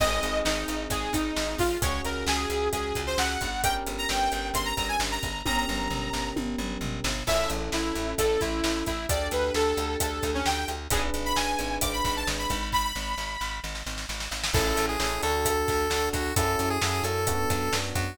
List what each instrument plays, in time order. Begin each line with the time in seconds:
0.00 electric bass (finger) G#1, electric piano 1 C4 D#4 G#4, lead 2 (sawtooth) D#5, kick, crash
0.23 electric bass (finger) G#1, closed hi-hat
0.45 electric bass (finger) G#1, lead 2 (sawtooth) D#4, snare
0.68 electric bass (finger) G#1, closed hi-hat
0.90 electric bass (finger) G#1, lead 2 (sawtooth) G#4, kick, closed hi-hat
1.13 electric bass (finger) G#1, lead 2 (sawtooth) D#4, kick, snare, closed hi-hat
1.36 electric bass (finger) G#1, snare
1.58 electric bass (finger) G#1, lead 2 (sawtooth) F4, kick, open hi-hat
1.82 electric bass (finger) C#2, electric piano 1 C#4 F#4 G#4, lead 2 (sawtooth) C#5, kick, closed hi-hat
2.05 electric bass (finger) C#2, lead 2 (sawtooth) A#4, closed hi-hat
2.26 electric bass (finger) C#2, lead 2 (sawtooth) G#4, snare
2.50 electric bass (finger) C#2, closed hi-hat
2.72 electric bass (finger) C#2, lead 2 (sawtooth) G#4, kick, closed hi-hat
2.95 electric bass (finger) C#2, kick, snare, closed hi-hat
3.07 lead 2 (sawtooth) C5
3.18 electric bass (finger) C#2, lead 2 (sawtooth) F#5, snare
3.41 electric bass (finger) G1, kick, closed hi-hat
3.64 electric piano 1 C#4 G4 A#4, lead 2 (sawtooth) G5, kick, closed hi-hat
3.87 electric bass (finger) G1, closed hi-hat
3.98 lead 2 (sawtooth) A#5
4.09 electric bass (finger) G1, lead 2 (sawtooth) G5, snare
4.32 electric bass (finger) G1, closed hi-hat
4.54 electric bass (finger) G1, lead 2 (sawtooth) C6, kick, closed hi-hat
4.65 lead 2 (sawtooth) A#5
4.77 electric bass (finger) G1, lead 2 (sawtooth) A#5, kick, snare, closed hi-hat
4.88 lead 2 (sawtooth) G#5
5.00 electric bass (finger) G1, snare
5.12 lead 2 (sawtooth) A#5
5.23 electric bass (finger) G1, kick, closed hi-hat
5.45 electric bass (finger) G1, electric piano 1 C#4 G4 A#4, lead 2 (sawtooth) A#5, kick, high tom
5.57 lead 2 (sawtooth) A#5
5.68 electric bass (finger) G1, mid tom
5.90 electric bass (finger) G1, floor tom
6.13 electric bass (finger) G1, snare
6.36 electric bass (finger) G1, high tom
6.58 electric bass (finger) G1, mid tom
6.81 electric bass (finger) G1, floor tom
7.04 electric bass (finger) G1, snare
7.27 electric bass (finger) A1, electric piano 1 C#4 E4 A4, lead 2 (sawtooth) E5, kick, crash
7.50 electric bass (finger) A1, closed hi-hat
7.72 electric bass (finger) A1, lead 2 (sawtooth) E4, snare
7.95 electric bass (finger) A1, closed hi-hat
8.18 electric bass (finger) A1, lead 2 (sawtooth) A4, kick, closed hi-hat
8.40 electric bass (finger) A1, lead 2 (sawtooth) E4, kick, snare, closed hi-hat
8.64 electric bass (finger) A1, snare
8.86 electric bass (finger) A1, lead 2 (sawtooth) E4, kick, closed hi-hat
9.09 electric bass (finger) D2, electric piano 1 D4 G4 A4, lead 2 (sawtooth) D5, kick, closed hi-hat
9.31 electric bass (finger) D2, lead 2 (sawtooth) B4, closed hi-hat
9.54 electric bass (finger) D2, lead 2 (sawtooth) A4, snare
9.77 electric bass (finger) D2, closed hi-hat
10.00 electric bass (finger) D2, lead 2 (sawtooth) A4, kick, closed hi-hat
10.23 electric bass (finger) D2, kick, snare, closed hi-hat
10.34 lead 2 (sawtooth) C#4
10.46 electric bass (finger) D2, lead 2 (sawtooth) G5, snare
10.68 electric bass (finger) D2, closed hi-hat
10.90 electric bass (finger) G#1, electric piano 1 D4 G#4 B4, lead 2 (sawtooth) G#4, kick, closed hi-hat
11.14 electric bass (finger) G#1, closed hi-hat
11.25 lead 2 (sawtooth) B5
11.36 electric bass (finger) G#1, lead 2 (sawtooth) G#5, snare
11.59 electric bass (finger) G#1, closed hi-hat
11.81 electric bass (finger) G#1, lead 2 (sawtooth) D6, kick, closed hi-hat
11.93 lead 2 (sawtooth) B5
12.04 electric bass (finger) G#1, lead 2 (sawtooth) B5, kick, snare, closed hi-hat
12.16 lead 2 (sawtooth) A5
12.27 electric bass (finger) G#1, snare
12.39 lead 2 (sawtooth) B5
12.50 electric bass (finger) G#1, kick, closed hi-hat
12.72 lead 2 (sawtooth) B5, kick, snare
12.84 lead 2 (sawtooth) B5
12.95 electric bass (finger) G#1, snare
13.18 electric bass (finger) G#1, snare
13.41 electric bass (finger) G#1, snare
13.64 electric bass (finger) G#1, snare
13.75 snare
13.86 electric bass (finger) G#1, snare
13.98 snare
14.09 electric bass (finger) G#1, snare
14.20 snare
14.31 electric bass (finger) G#1, snare
14.44 snare
14.54 electric bass (finger) A1, electric piano 1 C#4 E4 A4, lead 1 (square) A4, kick, crash
14.77 electric bass (finger) A1, closed hi-hat
14.89 lead 1 (square) G#4
15.00 electric bass (finger) A1, electric piano 1 C#4 E4 A4, snare
15.23 electric bass (finger) D2, electric piano 1 D4 F#4 A4, lead 1 (square) A4, closed hi-hat
15.45 kick, closed hi-hat
15.68 electric bass (finger) D2, kick, snare, closed hi-hat
15.90 electric bass (finger) D2, electric piano 1 D4 F#4 A4, snare
16.13 electric bass (finger) D2, lead 1 (square) F#4, kick, closed hi-hat
16.36 electric bass (finger) F#2, electric piano 1 C#4 E4 F#4 A4, lead 1 (square) A4, kick, closed hi-hat
16.59 electric bass (finger) F#2, closed hi-hat
16.70 lead 1 (square) G#4
16.81 electric bass (finger) F#2, electric piano 1 C#4 E4 F#4 A4, snare
17.04 electric bass (finger) F#2, lead 1 (square) A4, closed hi-hat
17.27 electric piano 1 B3 D4 F#4, kick, closed hi-hat
17.50 electric bass (finger) F#2, kick, snare, closed hi-hat
17.72 electric bass (finger) F#2, electric piano 1 B3 D4 F#4, snare
17.95 electric bass (finger) F#2, lead 1 (square) F#4, kick, closed hi-hat